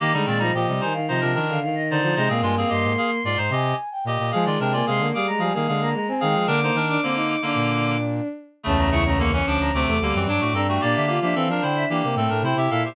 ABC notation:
X:1
M:4/4
L:1/16
Q:1/4=111
K:Cm
V:1 name="Choir Aahs"
e z d e g z a f e2 z f f e d2 | e f a f c'4 c'2 a3 g g2 | a z g a c' z d' b a2 z b b a g2 | d'3 d'9 z4 |
[K:Dm] a b ^c' b c' c' d' b d' d'3 d' d' b g | d e f e f f g e g g3 g g e c |]
V:2 name="Clarinet"
[B,G] [G,E] [E,C] [G,E] [Ge]2 [Ec] z [Ec] [DB] [DB]2 z2 [Ec]2 | [Ec] [CA] [A,F] [CA] [Ge]2 [Af] z [Fd] [Ec] [Ge]2 z2 [Ge]2 | [Af] [Fd] [DB] [Fd] [Af]2 [Af] z [Af] [Af] [Af]2 z2 [Af]2 | [DB] [Ec] [DB]2 [D,B,]3 [D,B,]5 z4 |
[K:Dm] [^C,A,]2 [C,A,] [C,A,] [D,B,] [E,^C] [F,D]2 [=C,A,]2 [D,B,] [E,=C] [^F,D] [A,^F] [CA] [A,F] | [B,G]2 [B,G] [B,G] [CA] [DB] [Ec]2 [B,G]2 [CA] [DB] [Ec] [Ge] [Af] [Ge] |]
V:3 name="Violin"
z A, A, F, F, G, E, E, F, F, E, D, E,3 F, | A, B,7 z8 | A,3 B, A, B, G, A, G, B, A, B, A, C A,2 | B, B, z D C E2 D7 z2 |
[K:Dm] ^C2 E C B, C3 =C A, G,2 D2 D2 | D2 F D C D3 D B, A,2 E2 E2 |]
V:4 name="Brass Section" clef=bass
E, D, B,,2 B,, C, z2 C, C, E,2 z2 D, D, | C, B,, G,,2 G,, A,, z2 A,, A,, C,2 z2 B,, B,, | F, E, C,2 C, D, z2 F, E, D,2 z2 E, F, | D,2 E,2 z4 B,,6 z2 |
[K:Dm] [^C,,E,,]6 D,, D,, D,, E,, D,, ^F,, G,, A,, G,,2 | B,, D,2 F, E, F, D,2 E, C, A,, A,, C, C, B,,2 |]